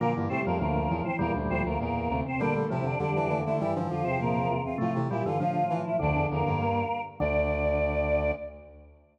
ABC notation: X:1
M:2/2
L:1/8
Q:1/2=100
K:Dm
V:1 name="Choir Aahs"
[B,B] z [Cc] [B,B] [B,B]3 [Cc] | [B,B] z [Cc] [B,B] [B,B]3 [Cc] | [Dd] z [Ee] [Dd] [Dd]3 [Ee] | [Ee] z [Ff] [Cc] [B,B]3 [Ff] |
[Ff] z [Ee] [Ff] [Ff]3 [Ee] | [Dd]2 [B,B]5 z | d8 |]
V:2 name="Flute"
[F,F] [E,E] [G,G]2 [D,D]2 [E,E] [E,E] | [E,E] [D,D] [F,F]2 [B,,B,]2 [C,C] [C,C] | [B,B] [A,A] [Cc]2 [G,G]2 [A,A] [A,A] | [E,E] [D,D] [F,F]2 [B,,B,]2 [F,F] [C,C] |
[F,F] [E,E] [G,G]2 [D,D]2 [E,E] [E,E] | [D,D]4 [B,B]2 z2 | d8 |]
V:3 name="Drawbar Organ"
[D,B,]2 [C,A,] [A,,F,] [A,,F,]4 | [B,,G,]3 z5 | [B,,G,]2 [A,,F,] [F,,D,] [F,,D,]4 | [G,,E,]2 [F,,D,] [E,,C,] [E,,C,]4 |
[C,A,]2 [B,,G,] [G,,E,] [A,,F,]4 | [F,,D,]5 z3 | D,8 |]
V:4 name="Brass Section" clef=bass
B,, G,, A,, F,, D,,2 E,, z | E,, D,, D,, D,, E,,2 D,, z | D,2 C,2 D, E, E, D, | G, F,5 z2 |
A,, C, B,, D, F,2 E, z | D,, E,, E,, G,,3 z2 | D,,8 |]